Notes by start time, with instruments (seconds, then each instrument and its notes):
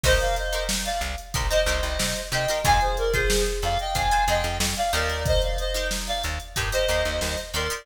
0.04 electric bass (finger) C2, acoustic guitar (steel) D#4 G4 A#4 C5, clarinet C5 D#5, kick, crash
0.20 clarinet D5 F5, closed hi-hat
0.36 clarinet C5 D#5, closed hi-hat
0.53 acoustic guitar (steel) D#4 G4 A#4 C5, closed hi-hat
0.69 snare
0.85 clarinet D5 F5, closed hi-hat
1.01 electric bass (finger) C2, closed hi-hat
1.18 closed hi-hat
1.34 electric bass (finger) C2, acoustic guitar (steel) D#4 G4 A#4 C5, kick, closed hi-hat
1.50 acoustic guitar (steel) D#4 G4 A#4 C5, clarinet C5 D#5, closed hi-hat
1.66 electric bass (finger) C2, acoustic guitar (steel) D#4 G4 A#4 C5, closed hi-hat
1.83 electric bass (finger) C2, closed hi-hat
1.99 electric bass (finger) C3, snare
2.16 closed hi-hat
2.32 electric bass (finger) C3, acoustic guitar (steel) D#4 G4 A#4 C5, clarinet D#5 G5, closed hi-hat
2.48 acoustic guitar (steel) D#4 G4 A#4 C5, snare, closed hi-hat
2.64 electric bass (finger) F2, acoustic guitar (steel) F4 G#4 C5, clarinet F5 G#5, kick, closed hi-hat
2.81 clarinet G#4 C5, closed hi-hat
2.97 clarinet A#4 D5, closed hi-hat
3.13 acoustic guitar (steel) F4 G#4 C5, clarinet G#4 C5, kick, closed hi-hat
3.30 snare
3.46 closed hi-hat
3.62 electric bass (finger) F2, clarinet D5 F5, snare, closed hi-hat
3.79 clarinet D#5 G5, closed hi-hat
3.95 electric bass (finger) F2, acoustic guitar (steel) F4 G#4 C5, clarinet F5 G#5, kick, closed hi-hat
4.11 acoustic guitar (steel) F4 G#4 C5, closed hi-hat
4.28 electric bass (finger) F2, acoustic guitar (steel) F4 G#4 C5, clarinet D#5 G5, closed hi-hat
4.44 electric bass (finger) F2, closed hi-hat
4.60 electric bass (finger) F2, snare
4.76 clarinet D5 F5, closed hi-hat
4.93 electric bass (finger) D#2, acoustic guitar (steel) D#4 G4 A#4 C5, clarinet A#4 D5, closed hi-hat
5.09 snare, closed hi-hat
5.26 clarinet C5 D#5, kick, closed hi-hat
5.42 clarinet D5 F5, closed hi-hat
5.58 clarinet C5 D#5, closed hi-hat
5.74 acoustic guitar (steel) D#4 G4 A#4 C5, snare, closed hi-hat
5.91 snare
6.07 clarinet D5 F5, snare, closed hi-hat
6.24 electric bass (finger) D#2, closed hi-hat
6.40 closed hi-hat
6.56 electric bass (finger) G2, acoustic guitar (steel) D#4 G4 A#4 C5, kick, closed hi-hat
6.72 acoustic guitar (steel) D#4 G4 A#4 C5, clarinet C5 D#5, closed hi-hat
6.88 electric bass (finger) D#2, acoustic guitar (steel) D#4 G4 A#4 C5, closed hi-hat
7.05 electric bass (finger) D#2, closed hi-hat
7.21 electric bass (finger) D#2, snare
7.37 closed hi-hat
7.54 electric bass (finger) D#2, acoustic guitar (steel) D#4 G4 A#4 C5, clarinet A#4 D5, closed hi-hat
7.70 acoustic guitar (steel) D#4 G4 A#4 C5, closed hi-hat